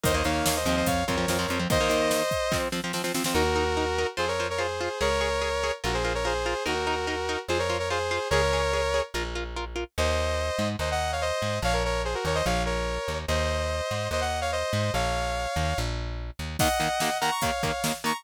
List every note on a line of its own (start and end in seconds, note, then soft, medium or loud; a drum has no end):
0.03 0.23 D#2 medium
0.03 0.12 D#3 medium
0.03 0.12 A#3 medium
0.03 0.14 C5 medium
0.03 0.14 D#5 loud
0.03 kick medium
0.03 closed hi-hat loud
0.14 0.23 D#3 medium
0.14 0.23 A#3 medium
0.14 0.25 C5 medium
0.14 0.25 D#5 medium
0.24 0.42 D#2 medium
0.24 0.58 D#3 medium
0.24 0.58 A#3 medium
0.24 0.44 C#5 medium
0.24 0.44 F5 medium
0.24 closed hi-hat medium
0.45 0.64 D#2 medium
0.45 0.55 C#5 medium
0.45 0.55 F5 medium
0.45 snare loud
0.56 0.66 C5 medium
0.56 0.66 D#5 medium
0.65 0.83 D#2 medium
0.65 1.03 F3 medium
0.65 1.03 C4 medium
0.65 0.76 C5 medium
0.65 0.76 D#5 medium
0.65 closed hi-hat medium
0.76 0.86 C5 medium
0.76 0.86 D#5 medium
0.86 1.04 F2 medium
0.86 1.04 C#5 medium
0.86 1.04 F5 medium
0.86 kick medium
0.86 closed hi-hat loud
1.07 1.26 F2 medium
1.07 1.16 F3 medium
1.07 1.16 C4 medium
1.07 1.58 A#4 medium
1.07 1.58 C#5 medium
1.07 kick medium
1.07 closed hi-hat medium
1.17 1.26 F3 medium
1.17 1.26 C4 medium
1.28 1.46 F2 medium
1.28 1.38 F3 medium
1.28 1.38 C4 medium
1.28 snare medium
1.39 1.47 F3 medium
1.39 1.47 C4 medium
1.48 1.66 F2 medium
1.48 1.58 F3 medium
1.48 1.58 C4 medium
1.48 closed hi-hat medium
1.59 1.68 F3 medium
1.59 1.68 C4 medium
1.70 1.78 D#3 medium
1.70 1.78 A#3 medium
1.70 2.57 C5 loud
1.70 2.57 D#5 loud
1.70 kick loud
1.70 closed hi-hat medium
1.80 1.89 D#3 medium
1.80 1.89 A#3 medium
1.89 2.22 D#3 medium
1.89 2.22 A#3 medium
1.89 closed hi-hat medium
2.11 snare medium
2.31 kick medium
2.31 closed hi-hat medium
2.52 2.68 F3 medium
2.52 2.68 C4 loud
2.52 kick medium
2.52 snare medium
2.72 2.81 F3 medium
2.72 2.81 C4 medium
2.72 snare medium
2.84 2.92 F3 medium
2.84 2.92 C4 medium
2.93 3.02 F3 medium
2.93 3.02 C4 medium
2.93 snare medium
3.04 3.12 F3 medium
3.04 3.12 C4 medium
3.04 snare medium
3.14 3.23 F3 medium
3.14 3.23 C4 medium
3.14 snare medium
3.24 3.34 F3 medium
3.24 3.34 C4 medium
3.24 snare loud
3.34 4.05 D#2 medium
3.34 3.43 D#4 medium
3.34 4.07 F#4 loud
3.34 4.07 A#4 loud
3.34 3.43 A#4 medium
3.56 3.64 D#4 medium
3.56 3.64 A#4 medium
3.77 3.85 D#4 medium
3.77 3.85 A#4 medium
3.98 4.07 D#4 medium
3.98 4.07 A#4 medium
4.17 4.89 F2 medium
4.17 4.25 F4 medium
4.17 4.28 G#4 medium
4.17 4.25 C5 medium
4.17 4.28 C5 medium
4.28 4.46 A#4 medium
4.28 4.46 C#5 medium
4.40 4.48 F4 medium
4.40 4.48 C5 medium
4.50 4.60 A#4 medium
4.50 4.60 C#5 medium
4.58 4.67 F4 medium
4.58 4.99 G#4 medium
4.58 4.67 C5 medium
4.58 4.99 C5 medium
4.81 4.89 F4 medium
4.81 4.89 C5 medium
5.01 5.71 C#2 medium
5.01 5.09 G#4 medium
5.01 5.71 A#4 loud
5.01 5.09 C#5 medium
5.01 5.71 C#5 loud
5.21 5.29 G#4 medium
5.21 5.29 C#5 medium
5.41 5.50 G#4 medium
5.41 5.50 C#5 medium
5.64 5.72 G#4 medium
5.64 5.72 C#5 medium
5.84 6.54 A#1 loud
5.84 5.92 F4 medium
5.84 5.94 F#4 medium
5.84 5.92 A#4 medium
5.84 5.94 A#4 medium
5.94 6.13 G#4 medium
5.94 6.13 C5 medium
6.05 6.13 F4 medium
6.05 6.13 A#4 medium
6.14 6.24 A#4 medium
6.14 6.24 C#5 medium
6.25 6.33 F4 medium
6.25 6.63 G#4 medium
6.25 6.33 A#4 medium
6.25 6.63 C5 medium
6.46 6.54 F4 medium
6.46 6.54 A#4 medium
6.66 7.37 D#2 medium
6.66 6.74 D#4 medium
6.66 7.39 F#4 medium
6.66 6.74 A#4 medium
6.66 7.39 A#4 loud
6.87 6.95 D#4 medium
6.87 6.95 A#4 medium
7.07 7.16 D#4 medium
7.07 7.16 A#4 medium
7.29 7.37 D#4 medium
7.29 7.37 A#4 medium
7.48 8.19 F2 medium
7.48 7.58 F4 medium
7.48 7.58 G#4 medium
7.48 7.58 C5 medium
7.59 7.77 A#4 medium
7.59 7.77 C#5 medium
7.70 7.78 F4 medium
7.70 7.78 C5 medium
7.79 7.89 A#4 medium
7.79 7.89 C#5 medium
7.90 7.99 F4 medium
7.90 8.28 G#4 medium
7.90 7.99 C5 medium
7.90 8.28 C5 medium
8.11 8.19 F4 medium
8.11 8.19 C5 medium
8.30 9.01 C#2 loud
8.30 8.41 G#4 medium
8.30 9.00 A#4 loud
8.30 9.00 C#5 loud
8.30 8.41 C#5 medium
8.53 8.61 G#4 medium
8.53 8.61 C#5 medium
8.73 8.82 G#4 medium
8.73 8.82 C#5 medium
8.94 9.02 G#4 medium
8.94 9.02 C#5 medium
9.14 9.84 A#1 medium
9.14 9.23 F4 medium
9.14 9.23 A#4 medium
9.35 9.44 F4 medium
9.35 9.44 A#4 medium
9.56 9.65 F4 medium
9.56 9.65 A#4 medium
9.76 9.84 F4 medium
9.76 9.84 A#4 medium
9.98 10.51 D#2 loud
9.98 10.68 C5 medium
9.98 10.68 D#5 loud
10.59 10.76 G#2 loud
10.79 11.32 D#2 loud
10.79 10.89 C5 medium
10.79 10.89 D#5 medium
10.91 11.11 D#5 medium
10.91 11.11 F#5 medium
11.12 11.22 C#5 medium
11.12 11.22 F5 medium
11.21 11.59 C5 medium
11.21 11.59 D#5 medium
11.42 11.60 G#2 medium
11.62 12.15 A#1 loud
11.62 11.73 C#5 medium
11.62 11.74 F5 loud
11.73 11.83 A#4 medium
11.73 11.83 C#5 loud
11.85 12.02 A#4 medium
11.85 12.02 C#5 medium
12.04 12.14 G#4 medium
12.04 12.14 C5 medium
12.14 12.24 F#4 medium
12.14 12.24 A#4 medium
12.25 12.42 D#2 medium
12.25 12.36 A#4 medium
12.25 12.36 C#5 medium
12.35 12.45 C5 medium
12.35 12.45 D#5 loud
12.46 12.98 A#1 loud
12.46 12.62 C#5 medium
12.46 12.62 F5 medium
12.65 13.18 A#4 medium
12.65 13.18 C#5 medium
13.08 13.26 D#2 medium
13.28 13.81 D#2 loud
13.28 14.08 C5 medium
13.28 14.08 D#5 medium
13.91 14.08 G#2 medium
14.11 14.64 D#2 medium
14.11 14.22 C5 medium
14.11 14.20 D#5 loud
14.21 14.40 D#5 medium
14.21 14.40 F#5 medium
14.41 14.51 C#5 medium
14.41 14.51 F5 medium
14.52 14.92 C5 medium
14.52 14.92 D#5 medium
14.73 14.91 G#2 loud
14.94 15.47 A#1 loud
14.94 15.78 C#5 medium
14.94 15.78 F5 medium
15.56 15.74 D#2 medium
15.78 16.31 A#1 loud
16.39 16.57 D#2 medium
16.59 16.68 D#2 medium
16.59 16.68 D#3 medium
16.59 16.68 A#3 medium
16.59 17.17 D#5 medium
16.59 17.17 F#5 loud
16.59 kick medium
16.59 crash loud
16.80 16.88 D#2 medium
16.80 16.88 D#3 medium
16.80 16.88 A#3 medium
16.80 closed hi-hat medium
17.00 17.09 D#2 medium
17.00 17.09 D#3 medium
17.00 17.09 A#3 medium
17.00 snare medium
17.21 17.30 D#2 medium
17.21 17.30 D#3 medium
17.21 17.30 A#3 medium
17.21 17.31 F#5 medium
17.21 17.31 A#5 loud
17.21 closed hi-hat medium
17.31 17.41 A#5 medium
17.31 17.41 C#6 medium
17.41 17.51 D#2 medium
17.41 17.51 D#3 medium
17.41 17.51 A#3 medium
17.41 17.93 C#5 medium
17.41 17.93 F5 medium
17.41 kick medium
17.41 closed hi-hat medium
17.63 17.71 D#2 medium
17.63 17.71 D#3 medium
17.63 17.71 A#3 medium
17.63 kick medium
17.63 closed hi-hat medium
17.84 17.92 D#2 medium
17.84 17.92 D#3 medium
17.84 17.92 A#3 medium
17.84 snare loud
18.04 18.12 D#2 medium
18.04 18.12 D#3 medium
18.04 18.12 A#3 medium
18.04 18.14 A#5 medium
18.04 18.14 C#6 medium
18.04 closed hi-hat medium
18.14 18.24 A#5 medium
18.14 18.24 C#6 medium